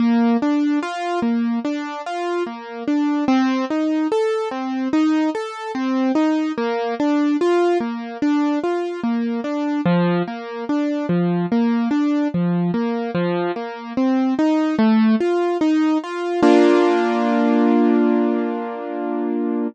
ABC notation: X:1
M:4/4
L:1/8
Q:1/4=73
K:Bb
V:1 name="Acoustic Grand Piano"
B, D F B, D F B, D | C E A C E A C E | B, D F B, D F B, D | F, B, D F, B, D F, B, |
F, B, C E A, F E F | [B,DF]8 |]